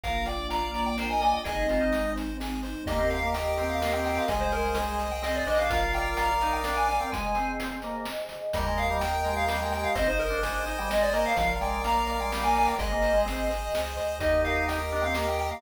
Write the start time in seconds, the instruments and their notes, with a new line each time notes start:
0.03 synth bass 1 A#1, pad 2 (warm) A#3 D4 F4, drawbar organ A#4, lead 1 (square) A#4 F5, kick, closed hi-hat
0.26 lead 1 (square) D5 G5, drawbar organ D5, closed hi-hat
0.50 drawbar organ D5, lead 1 (square) F5 A#5, closed hi-hat
0.74 lead 1 (square) D5, closed hi-hat
0.86 drawbar organ D5, lead 1 (square) G5
0.98 lead 1 (square) A#4, drawbar organ C5, snare
1.10 drawbar organ D#5, lead 1 (square) G#5
1.21 lead 1 (square) D5 G#5, closed hi-hat
1.33 lead 1 (square) G5
1.44 synth bass 1 G#1, pad 2 (warm) G#3 C4 D#4, drawbar organ G#4, lead 1 (square) G#4 D#5, kick, closed hi-hat
1.68 drawbar organ F4, lead 1 (square) C5, closed hi-hat
1.81 drawbar organ D#4
1.92 lead 1 (square) D#5, closed hi-hat
2.16 lead 1 (square) C5, closed hi-hat
2.40 lead 1 (square) G#4, snare
2.63 lead 1 (square) C5, closed hi-hat
2.86 synth bass 1 D#2, drawbar organ A#3, pad 2 (warm) G4 A#4 D#5, lead 1 (square) G4 D#5, kick, closed hi-hat
2.98 drawbar organ C4
3.10 lead 1 (square) A#4 F5, closed hi-hat
3.23 drawbar organ A#3
3.34 lead 1 (square) D#5 G5, closed hi-hat
3.57 drawbar organ C4, lead 1 (square) A#4, closed hi-hat
3.70 lead 1 (square) F5
3.81 drawbar organ A#3, lead 1 (square) G4, snare
3.92 drawbar organ C4, lead 1 (square) G5
4.05 lead 1 (square) A#4 G5, open hi-hat
4.17 lead 1 (square) F5
4.28 synth bass 1 C2, drawbar organ G#3, pad 2 (warm) G#4 C5 D#5, lead 1 (square) G#4 D#5, kick, closed hi-hat
4.41 lead 1 (square) C5
4.52 lead 1 (square) A#4 C5, closed hi-hat
4.75 lead 1 (square) D#5, closed hi-hat
4.99 lead 1 (square) C5, closed hi-hat
5.11 lead 1 (square) G5
5.22 drawbar organ C4, lead 1 (square) G#4 D#5, snare
5.35 lead 1 (square) D5
5.47 synth bass 1 A#1, drawbar organ D4, lead 1 (square) C5 D#5, open hi-hat
5.59 drawbar organ D4, lead 1 (square) F5
5.70 drawbar organ F4, lead 1 (square) A#4 F5, pad 2 (warm) A#4 D5 F5, kick, closed hi-hat
5.93 lead 1 (square) D5 G5, closed hi-hat
6.17 lead 1 (square) F5 A#5, closed hi-hat
6.41 drawbar organ D#4, lead 1 (square) D5, closed hi-hat
6.53 lead 1 (square) G5
6.64 drawbar organ D4, lead 1 (square) A#4, snare
6.77 lead 1 (square) G#5
6.89 lead 1 (square) D5 G#5, closed hi-hat
7.00 drawbar organ C4, lead 1 (square) G5
7.12 drawbar organ G#3, pad 2 (warm) G#4 C5 D#5, lead 1 (square) G#5, kick, closed hi-hat
7.35 drawbar organ C4, closed hi-hat
7.60 closed hi-hat
7.82 drawbar organ A#3, closed hi-hat
8.05 snare
8.29 closed hi-hat
8.53 synth bass 1 D#2, drawbar organ G3, pad 2 (warm) G4 A#4 D#5, lead 1 (square) A#4 D#5, kick, closed hi-hat
8.66 drawbar organ G#3
8.78 lead 1 (square) D#5 F5, closed hi-hat
8.90 drawbar organ G3
9.01 lead 1 (square) G5, closed hi-hat
9.25 drawbar organ G#3, lead 1 (square) D#5, closed hi-hat
9.37 lead 1 (square) F5
9.48 drawbar organ G3, lead 1 (square) A#4, snare
9.60 drawbar organ G#3, lead 1 (square) G5
9.72 lead 1 (square) D#5 G5, closed hi-hat
9.84 lead 1 (square) F5
9.95 synth bass 1 G#1, drawbar organ C4, pad 2 (warm) G#4 C5 D#5, lead 1 (square) C5 D#5, kick, closed hi-hat
10.06 drawbar organ D#4, lead 1 (square) C5
10.19 lead 1 (square) A#4 D#5, closed hi-hat
10.30 drawbar organ D4
10.43 lead 1 (square) G#5, closed hi-hat
10.66 drawbar organ D#4, lead 1 (square) D#5, closed hi-hat
10.78 drawbar organ G3, lead 1 (square) G5
10.89 drawbar organ G#3, lead 1 (square) C5 D#5, snare
11.02 lead 1 (square) D5
11.13 drawbar organ A#3, lead 1 (square) A#4 D#5, closed hi-hat
11.26 lead 1 (square) F5
11.36 synth bass 1 A#1, drawbar organ F3, pad 2 (warm) A#4 D5 F5, lead 1 (square) F5, kick, closed hi-hat
11.61 drawbar organ G#3, lead 1 (square) D5 G5, closed hi-hat
11.84 drawbar organ A#3, lead 1 (square) F5 A#5, closed hi-hat
12.07 lead 1 (square) D5, closed hi-hat
12.20 drawbar organ G#3, lead 1 (square) G5
12.32 drawbar organ G3, lead 1 (square) A#4, snare
12.43 drawbar organ A#3, lead 1 (square) G#5
12.55 lead 1 (square) D5 G#5, open hi-hat
12.67 lead 1 (square) G5
12.78 synth bass 1 G#1, drawbar organ G#3, lead 1 (square) G#4 D#5, pad 2 (warm) G#4 C5 D#5, kick, closed hi-hat
12.92 drawbar organ A#3
13.02 lead 1 (square) C5, closed hi-hat
13.14 drawbar organ G#3
13.25 drawbar organ C4, lead 1 (square) D#5, closed hi-hat
13.50 lead 1 (square) C5, closed hi-hat
13.73 synth bass 1 C#2, lead 1 (square) G#4, snare
13.97 synth bass 1 D2, lead 1 (square) C5, closed hi-hat
14.20 synth bass 1 D#2, drawbar organ D#4, lead 1 (square) G4 D#5, pad 2 (warm) G4 A#4 D#5, kick, closed hi-hat
14.44 lead 1 (square) A#4 F5, closed hi-hat
14.68 lead 1 (square) D#5 G5, closed hi-hat
14.91 drawbar organ D4, lead 1 (square) A#4, closed hi-hat
15.03 drawbar organ C4, lead 1 (square) F5
15.14 drawbar organ A#3, lead 1 (square) G4, snare
15.27 lead 1 (square) G5
15.39 lead 1 (square) A#4 G5, closed hi-hat
15.51 drawbar organ A#3, lead 1 (square) F5